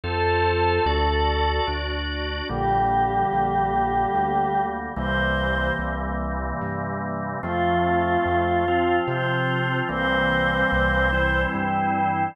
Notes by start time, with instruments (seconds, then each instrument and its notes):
0.04 synth bass 1 F2, drawbar organ F4 A4 C5, choir aahs A4
0.86 synth bass 1 D2, drawbar organ F#4 A4 D5
1.67 synth bass 1 D2, drawbar organ D4 F#4 D5
2.49 synth bass 1 A#1, drawbar organ D3 G3 A#3, choir aahs G4
3.32 synth bass 1 A#1
4.14 synth bass 1 D2
4.96 synth bass 1 C2, drawbar organ C3 E3 G3 A#3, choir aahs C5
5.79 synth bass 1 C2
6.61 synth bass 1 G2
7.43 synth bass 1 F2, drawbar organ F3 A3 C4, choir aahs F4
8.26 synth bass 1 F2
8.68 drawbar organ F3 C4 F4
9.07 synth bass 1 C3, choir aahs C5
9.89 synth bass 1 C2, drawbar organ E3 G3 A#3 C4, choir aahs C5
10.72 synth bass 1 C2
11.13 drawbar organ E3 G3 C4 E4
11.54 synth bass 1 G2, choir aahs G5